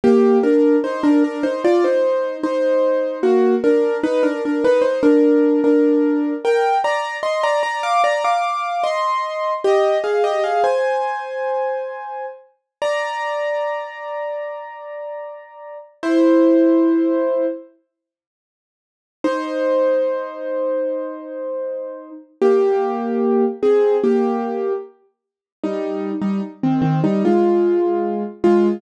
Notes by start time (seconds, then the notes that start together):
0.04 A#3 G4
0.43 D4 A#4
0.84 D#4 C5
1.03 D4 A#4
1.24 D4 A#4
1.43 D#4 C5
1.65 F4 D5
1.84 D#4 C5
2.44 D#4 C5
3.23 A#3 F#4
3.64 D4 A#4
4.04 D#4 B4
4.23 D4 A#4
4.45 D4 A#4
4.64 D#4 B4
4.82 D#4 C5
5.03 D4 A#4
5.64 D4 A#4
6.45 A#4 G5
6.84 D5 A#5
7.23 D#5 C6
7.43 D5 A#5
7.63 D5 A#5
7.83 F5 D6
8.04 D5 A#5
8.25 F5 D6
8.84 D#5 C6
9.64 G4 D#5
10.04 G#4 F5
10.24 G4 D#5
10.44 G#4 F5
10.64 C5 G#5
12.82 D5 A#5
16.03 E4 C5
19.24 D#4 C5
22.42 A#3 G4
23.63 C4 G#4
24.04 A#3 G4
25.64 G3 D#4
26.22 G3 D#4
26.63 D#3 C4
26.82 D#3 C4
27.04 G3 D#4
27.25 G#3 F4
28.44 G#3 F4